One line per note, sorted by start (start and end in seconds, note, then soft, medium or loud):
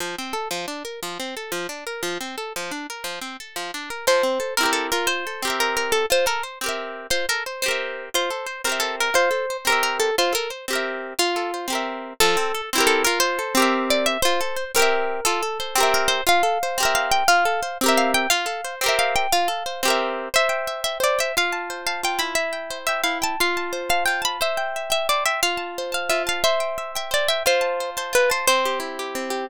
0.00 0.16 F3 medium
0.18 0.34 C4 medium
0.33 0.48 A4 medium
0.51 0.66 F3 medium
0.68 0.83 D4 medium
0.85 1.00 A#4 medium
1.03 1.18 F3 medium
1.20 1.35 C4 medium
1.37 1.52 A4 medium
1.52 1.67 F3 medium
1.69 1.84 D4 medium
1.87 2.02 A#4 medium
2.03 2.18 F3 medium
2.21 2.36 C4 medium
2.38 2.53 A4 medium
2.56 2.71 F3 medium
2.71 2.87 D4 medium
2.90 3.05 A#4 medium
3.04 3.19 F3 medium
3.21 3.37 C4 medium
3.40 3.55 A4 medium
3.56 3.71 F3 medium
3.74 3.89 D4 medium
3.90 4.06 A#4 medium
4.07 4.22 F3 medium
4.07 4.54 C5 medium
4.23 4.39 C4 medium
4.40 4.55 A4 medium
4.57 4.90 C4 medium
4.57 4.90 E4 medium
4.57 4.71 A#4 medium
4.63 4.90 G4 medium
4.63 4.90 A#4 medium
4.73 4.87 A4 medium
4.92 5.25 F4 medium
4.92 5.07 A#4 medium
5.07 5.51 C5 medium
5.27 5.42 A4 medium
5.42 6.05 C4 medium
5.42 6.05 G4 medium
5.47 6.05 A#4 medium
5.47 6.05 E5 medium
5.60 5.75 A#4 medium
5.77 5.92 A#4 medium
5.92 6.06 A4 medium
6.10 6.25 F4 medium
6.10 6.26 C5 medium
6.26 6.41 A4 medium
6.26 6.43 A#4 medium
6.43 6.59 C5 medium
6.61 7.07 C4 medium
6.61 7.07 G4 medium
6.66 7.07 A#4 medium
6.66 7.07 E5 medium
7.10 7.26 F4 medium
7.10 7.26 C5 medium
7.29 7.44 A4 medium
7.29 7.43 A#4 medium
7.46 7.62 C5 medium
7.62 8.09 C4 loud
7.62 8.09 G4 medium
7.62 8.05 C5 medium
7.68 8.09 A#4 medium
7.68 8.09 E5 medium
8.14 8.30 F4 medium
8.14 8.59 C5 medium
8.30 8.46 A4 medium
8.46 8.62 C5 medium
8.64 9.10 C4 medium
8.64 9.10 G4 medium
8.64 8.81 A#4 medium
8.69 9.10 A#4 medium
8.69 9.10 E5 medium
8.80 8.96 A4 medium
9.00 9.14 A#4 medium
9.14 9.29 F4 medium
9.14 9.57 C5 medium
9.31 9.46 A4 medium
9.50 9.65 C5 medium
9.65 10.11 C4 medium
9.65 10.11 G4 medium
9.65 9.82 A#4 medium
9.70 10.11 A#4 medium
9.70 10.11 E5 medium
9.83 9.97 A#4 medium
10.00 10.16 A4 medium
10.18 10.33 F4 medium
10.18 10.33 C5 medium
10.33 10.48 A4 medium
10.33 10.50 A#4 medium
10.50 10.66 C5 medium
10.68 11.14 C4 medium
10.68 11.14 G4 medium
10.73 11.14 A#4 medium
10.73 11.14 E5 medium
11.19 11.67 F4 medium
11.36 11.51 A4 medium
11.54 11.69 C5 medium
11.68 12.13 C4 medium
11.68 12.13 G4 medium
11.73 12.13 A#4 medium
11.73 12.13 E5 medium
12.20 12.36 F3 loud
12.20 12.62 A4 medium
12.37 12.52 C4 medium
12.55 12.70 A4 medium
12.73 13.05 C4 loud
12.73 13.05 E4 loud
12.78 13.05 G4 loud
12.78 13.05 A#4 loud
12.87 13.02 A4 medium
13.05 13.39 F4 loud
13.05 13.19 A#4 medium
13.20 13.65 C5 medium
13.39 13.54 A4 medium
13.55 14.17 C4 loud
13.55 14.17 G4 loud
13.60 14.17 A#4 loud
13.60 14.17 E5 loud
13.90 14.07 D5 medium
14.06 14.21 E5 medium
14.22 14.40 F4 loud
14.22 14.64 C5 medium
14.41 14.56 A4 medium
14.56 14.72 C5 medium
14.75 15.20 C4 loud
14.75 15.20 G4 loud
14.75 15.24 A#4 medium
14.82 15.20 E5 loud
15.25 15.41 F4 loud
15.25 15.75 A4 medium
15.43 15.58 A4 medium
15.60 15.75 C5 medium
15.75 16.21 C4 loud
15.75 16.21 G4 loud
15.80 16.21 A#4 loud
15.80 16.21 E5 loud
15.94 16.10 A#4 medium
16.08 16.24 C5 medium
16.27 16.42 F4 loud
16.27 16.78 F5 medium
16.43 16.58 A4 medium
16.63 16.78 C5 medium
16.78 17.24 C4 loud
16.78 17.24 G4 loud
16.83 17.24 A#4 loud
16.83 17.24 E5 loud
16.95 17.11 F5 medium
17.12 17.27 G5 medium
17.28 17.44 F4 loud
17.28 17.78 F5 medium
17.45 17.61 A4 medium
17.63 17.78 C5 medium
17.81 18.27 C4 loud
17.81 18.27 G4 loud
17.86 18.27 A#4 loud
17.86 18.27 E5 loud
17.97 18.12 F5 medium
18.14 18.29 G5 medium
18.30 18.46 F4 loud
18.30 18.75 F5 medium
18.46 18.61 A4 medium
18.64 18.80 C5 medium
18.81 19.27 C4 loud
18.81 19.27 G4 loud
18.86 19.27 A#4 loud
18.86 19.27 E5 loud
18.99 19.15 F5 medium
19.16 19.32 G5 medium
19.32 19.48 F4 loud
19.32 19.90 F5 medium
19.48 19.63 A4 medium
19.66 19.81 C5 medium
19.83 20.29 C4 loud
19.83 20.29 G4 loud
19.88 20.29 A#4 loud
19.88 20.29 E5 loud
20.34 21.00 C5 loud
20.34 20.81 E5 medium
20.49 20.85 G5 medium
20.67 21.32 E5 medium
20.84 20.98 E5 medium
20.84 21.18 G5 medium
21.00 21.32 C5 medium
21.00 21.19 D5 medium
21.19 21.35 E5 medium
21.19 21.35 G5 medium
21.37 22.03 F4 medium
21.37 21.82 F5 medium
21.52 21.86 A5 medium
21.70 22.34 C5 medium
21.87 22.01 F5 medium
21.87 22.35 A5 medium
22.03 22.36 F4 medium
22.03 22.21 G5 medium
22.19 23.03 E4 medium
22.19 22.33 B5 medium
22.35 22.78 E5 medium
22.53 22.88 G5 medium
22.70 23.35 C5 medium
22.87 23.01 E5 medium
22.87 23.21 G5 medium
23.04 23.36 E4 medium
23.04 23.19 F5 medium
23.22 23.38 G5 medium
23.22 23.40 A5 medium
23.40 24.07 F4 loud
23.40 23.82 F5 medium
23.57 23.89 A5 medium
23.73 24.37 C5 medium
23.89 24.04 F5 medium
23.89 24.21 A5 medium
24.06 24.40 F4 medium
24.06 24.22 G5 medium
24.22 24.38 A5 medium
24.22 24.40 B5 medium
24.41 25.09 C5 medium
24.41 24.91 E5 medium
24.57 24.90 G5 medium
24.76 25.40 E5 medium
24.90 25.07 E5 medium
24.90 25.25 G5 medium
25.09 25.42 C5 medium
25.09 25.24 D5 medium
25.26 25.40 E5 medium
25.26 25.42 G5 medium
25.43 26.10 F4 medium
25.43 25.91 F5 medium
25.57 25.92 A5 medium
25.78 26.43 C5 medium
25.92 26.11 F5 medium
25.92 26.26 A5 medium
26.10 26.42 F4 medium
26.10 26.23 E5 medium
26.27 26.43 F5 medium
26.27 26.43 A5 medium
26.44 27.11 C5 loud
26.44 26.92 E5 medium
26.60 26.95 G5 medium
26.78 27.42 E5 medium
26.95 27.10 E5 medium
26.95 27.29 G5 medium
27.11 27.43 C5 medium
27.11 27.28 D5 medium
27.28 27.43 E5 medium
27.28 27.46 G5 medium
27.46 28.12 F4 loud
27.46 27.90 C5 medium
27.61 27.96 A5 medium
27.80 28.45 C5 medium
27.97 28.14 C5 medium
27.97 28.29 A5 medium
28.13 28.45 F4 medium
28.13 28.30 B4 medium
28.30 28.47 C5 medium
28.30 28.46 A5 medium
28.47 29.15 C4 medium
28.47 28.79 C5 medium
28.65 28.99 G4 medium
28.80 29.44 E4 medium
28.99 29.30 G4 medium
29.15 29.47 C4 medium
29.30 29.46 G4 medium